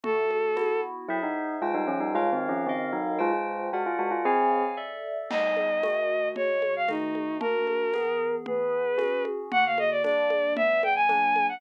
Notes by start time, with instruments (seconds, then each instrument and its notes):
0.04 electric piano 2 D3 A3 F#4, violin A4, low conga
0.31 high conga
0.56 electric piano 2 B3 E4 F#4, tambourine, high conga
1.09 tubular bells F#3 E4, electric piano 2 G#4 C5 E5
1.23 tubular bells D#4
1.62 tubular bells G#3 F4, electric piano 2 F4 C5 G5
1.74 tubular bells G3 D#4
1.87 tubular bells F3 C#4
2.00 tubular bells G3 D#4
2.15 tubular bells G#3 F4, electric piano 2 A#4 C#5 F5
2.33 tubular bells D#3 C4
2.49 tubular bells F3 C#4
2.66 tubular bells D#3 C4, electric piano 2 A#4 D#5 F5
2.93 tubular bells F#3 D#4
3.18 tubular bells G#3 F4, electric piano 2 F4 C5 G5
3.33 tubular bells G#3 F4
3.73 tubular bells G#3 F#4, electric piano 2 A#4 D5 F#5
3.86 tubular bells F4
3.99 tubular bells G#3 F#4
4.11 tubular bells F4
4.25 tubular bells C4 G#4, electric piano 2 C#5 F5 G#5
4.77 electric piano 2 A4 D5 E5
5.31 electric piano 2 G3 B3 D#4, violin D#5, crash, low conga
5.57 high conga
5.83 electric piano 2 D#3 A3 F#4, tambourine, high conga
6.36 electric piano 2 C#3 G#3 F#4, violin C#5, low conga
6.62 high conga
6.76 violin F5
6.88 electric piano 2 D#3 A3 F#4, violin D#4, tambourine, high conga
7.15 high conga
7.41 electric piano 2 A#3 D4 F#4, violin A#4, low conga
7.67 high conga
7.93 electric piano 2 E3 B3 G#4, tambourine, high conga
8.46 electric piano 2 E3 B3 G#4, violin B4, low conga
8.97 electric piano 2 C#4 F#4 G#4, tambourine, high conga
9.25 high conga
9.52 electric piano 2 D3 A#3 F#4, violin F#5, low conga
9.66 violin F5
9.78 violin D#5, high conga
9.91 violin D5
10.04 electric piano 2 G3 A#3 D4, violin D5, tambourine, high conga
10.30 high conga
10.56 electric piano 2 E3 G3 B3, violin E5, low conga
10.83 violin G5, high conga
10.95 violin G#5
11.09 electric piano 2 F#3 A#3 D4, tambourine, high conga
11.36 high conga
11.49 violin F#5